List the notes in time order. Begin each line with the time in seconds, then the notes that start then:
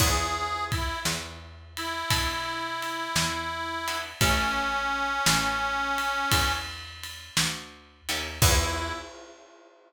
0.00 E2 B3 D4 E4 G#4, kick, crash
0.72 E4, kick, ride
1.05 E2, snare
1.77 E4, ride
2.10 B2 B3 D4 E4 G#4, kick, ride
2.82 ride
3.16 E2, snare
3.88 B3 D4 E4 G#4, ride
4.21 A1 C#4 E4 G4 A4, kick, ride
5.26 A1, snare, ride
5.98 ride
6.32 E2, kick, ride
7.04 ride
7.37 D2, snare
8.09 D#2 C#4 E4 G4 A4, ride
8.42 E2 B3 D4 E4 G#4, kick, crash